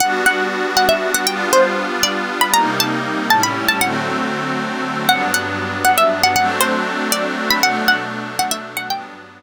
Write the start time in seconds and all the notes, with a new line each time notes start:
0.00 G3 B3 D4 F#4 F#5
0.26 F#5
0.77 F#5
0.89 E5
1.14 F#5
1.27 G3 B3 D4 F4 G5
1.53 C5
2.03 D5
2.41 B5
2.54 C3 G3 A#3 D#4 A#5
2.80 A5
3.30 A2 G3 C#4 E4 A5
3.43 B5
3.69 A5
3.81 D3 F#3 A3 C4 F#5
5.08 G2 F#3 B3 D4 F#5
5.34 F#5
5.85 F#5
5.98 E5
6.23 F#5
6.36 F#3 A3 C4 D4 F#5
6.61 C5
7.12 D5
7.51 B5
7.63 B2 F#3 A3 D4 F#5
7.88 F#5
8.39 F#5
8.51 E5
8.77 F#5
8.90 G2 F#3 B3 D4 G5